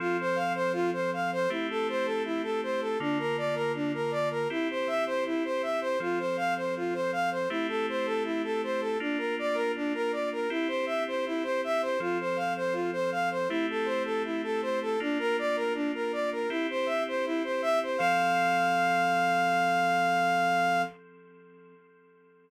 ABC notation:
X:1
M:4/4
L:1/16
Q:1/4=80
K:F
V:1 name="Ocarina"
F c f c F c f c E A c A E A c A | D B d B D B d B E c e c E c e c | F c f c F c f c E A c A E A c A | D B d B D B d B E c e c E c e c |
F c f c F c f c E A c A E A c A | D B d B D B d B E c e c E c e c | f16 |]
V:2 name="Electric Piano 2"
[F,CA]8 [A,CEG]8 | [D,B,F]8 [CEG]8 | [F,CA]8 [A,CEG]8 | [B,DF]8 [CEG]8 |
[F,CA]8 [A,CEG]8 | [B,DF]8 [CEG]8 | [F,CA]16 |]